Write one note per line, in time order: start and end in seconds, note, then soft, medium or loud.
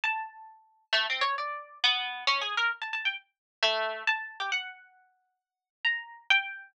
0.04 0.84 A5 medium
0.93 1.06 A3 loud
1.10 1.23 C4 medium
1.21 1.35 C#5 loud
1.38 1.78 D5 medium
1.84 2.24 B3 loud
2.27 2.41 C#4 loud
2.42 2.55 G#4 medium
2.57 2.71 A#4 medium
2.82 2.92 A5 medium
2.93 3.03 A5 medium
3.05 3.15 G5 medium
3.63 4.03 A3 loud
4.07 4.38 A5 loud
4.40 4.50 G4 medium
4.52 5.73 F#5 medium
5.85 6.25 A#5 medium
6.30 6.71 G5 loud